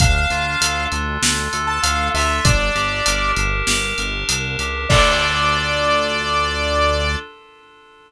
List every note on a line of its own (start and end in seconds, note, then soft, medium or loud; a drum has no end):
0.00 0.26 D2 loud
0.00 0.92 D4 medium
0.00 0.85 F5 medium
0.00 kick loud
0.00 closed hi-hat loud
0.30 0.56 D2 medium
0.30 1.22 F4 medium
0.30 closed hi-hat medium
0.61 0.87 D2 loud
0.61 1.52 A4 medium
0.61 closed hi-hat loud
0.92 1.18 D2 loud
0.92 1.83 D4 medium
0.92 closed hi-hat medium
1.22 1.48 D2 medium
1.22 2.15 F4 medium
1.22 snare loud
1.53 1.79 D2 medium
1.53 2.40 A4 medium
1.53 closed hi-hat medium
1.67 1.81 A5 medium
1.82 2.10 D2 loud
1.82 2.41 D4 medium
1.82 2.09 F5 medium
1.82 closed hi-hat loud
2.14 2.40 D2 loud
2.14 2.44 F4 medium
2.14 2.43 E5 medium
2.14 open hi-hat medium
2.45 2.71 G1 loud
2.45 3.37 D4 loud
2.45 3.32 D5 medium
2.45 kick loud
2.45 closed hi-hat loud
2.75 3.01 G1 loud
2.75 3.67 G4 medium
2.75 closed hi-hat medium
3.06 3.33 G1 medium
3.06 3.98 A#4 medium
3.06 closed hi-hat loud
3.36 3.63 G1 loud
3.36 4.28 D4 medium
3.36 closed hi-hat medium
3.67 3.93 G1 loud
3.67 4.59 G4 medium
3.67 snare loud
3.98 4.24 G1 loud
3.98 4.86 A#4 medium
3.98 closed hi-hat medium
4.28 4.56 C2 medium
4.28 4.86 D4 medium
4.28 closed hi-hat loud
4.59 4.86 C#2 medium
4.59 4.89 G4 medium
4.59 closed hi-hat medium
4.89 7.16 D2 loud
4.89 7.16 D4 loud
4.89 7.16 F4 medium
4.89 7.16 A4 loud
4.89 7.15 D5 loud
4.89 kick loud
4.89 crash loud